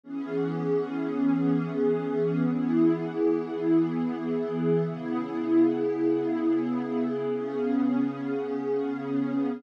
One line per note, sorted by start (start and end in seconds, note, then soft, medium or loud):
0.04 2.42 E3 medium
0.04 2.42 B3 medium
0.04 2.42 C#4 medium
0.04 2.42 G#4 medium
2.44 4.82 E3 medium
2.44 4.82 B3 medium
2.44 4.82 E4 medium
2.44 4.82 G#4 medium
4.84 7.22 C#3 medium
4.84 7.22 B3 medium
4.84 7.22 E4 medium
4.84 7.22 G#4 medium
7.23 9.61 C#3 medium
7.23 9.61 B3 medium
7.23 9.61 C#4 medium
7.23 9.61 G#4 medium